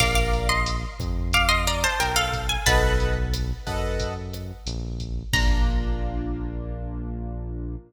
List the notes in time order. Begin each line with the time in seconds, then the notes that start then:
0.00 A#1 A#4 D5 F5 D6, kick, cross-stick, crash
0.15 F5 D6
0.33 closed hi-hat
0.49 D#5 C6
0.66 closed hi-hat
0.99 F2, kick, cross-stick, closed hi-hat
1.33 F5 D6, kick, closed hi-hat
1.48 D#5 C6
1.67 D5 A#5, closed hi-hat
1.84 C5 A5
2.00 B1 A#4 G5, cross-stick, closed hi-hat
2.16 A4 F5
2.33 kick, closed hi-hat
2.49 G#5
2.66 B1 A4 B4 D#5 F#5 A5, kick, closed hi-hat
3.00 closed hi-hat
3.33 cross-stick, closed hi-hat
3.67 F#2 A4 B4 D#5 F#5, kick, closed hi-hat
3.99 kick, closed hi-hat
4.33 cross-stick, closed hi-hat
4.66 A#1, closed hi-hat
5.00 kick, closed hi-hat
5.33 A#1 A#3 D4 F4 A#5, kick, crash